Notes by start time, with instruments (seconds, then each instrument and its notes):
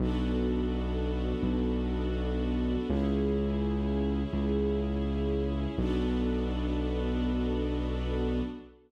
0.00 synth bass 2 B1, string ensemble 1 B3 D4 F#4 A4
1.43 synth bass 2 B1
2.89 synth bass 2 C#2, string ensemble 1 C#4 E4 G#4
4.33 synth bass 2 C#2
5.78 synth bass 2 B1, string ensemble 1 B3 D4 F#4 A4